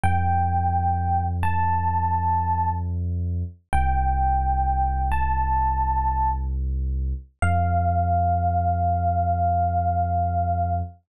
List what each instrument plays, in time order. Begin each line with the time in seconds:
0.04 synth bass 2 F2, electric piano 1 G5
1.43 electric piano 1 A5
3.73 synth bass 2 C2, electric piano 1 G5
5.12 electric piano 1 A5
7.42 synth bass 2 F2, electric piano 1 F5